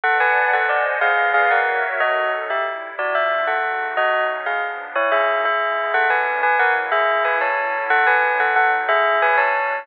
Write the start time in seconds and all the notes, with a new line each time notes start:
0.03 A4 B4 D5 F#5 A5
0.20 B4 G#5
0.53 A4 C5 D#5 F#5 G#5
0.69 D5
1.01 C#4 G#4 B4 D5 F5
1.34 G#4 F5
1.51 F#4 A#4 C#5 E5 F#5
2.00 F#3 C#4 D#4 F#4 A4 D#5
2.50 C3 G3 E4 G4 E5
2.98 C#3 B3 D4 F4 F#4 D5
3.15 E5
3.47 C#3 A3 D#4 F#4 A4 F#5
3.96 F#3 A3 C#4 D#4 F#4 D#5
4.46 C#3 F3 B3 D4 G#4 F5
4.95 B2 A#3 C#4 D#4 E4 C#5
5.12 G#4 E5
5.44 C#3 G#3 B3 E4 G#4 E5
5.93 B2 A3 C#4 D4 A4 F#5
6.10 B4 G#5
6.43 F#3 G#3 A#3 E4 B4 G#5
6.59 A#4 F#5
6.92 C#3 G#3 A#3 E4 G#4 E5
7.25 B4 G#5
7.41 D3 F#3 C#4 E4 C#5 A5
7.90 E3 F#3 G#3 D#4 A4 F#5
8.07 B4 G#5
8.40 B2 F#3 D#4 A4 F#5
8.56 A4 F#5
8.89 A2 F#3 C#4 E4 G#4 E5
9.22 B4 G#5
9.37 B2 A3 C#4 D4 C#5 A5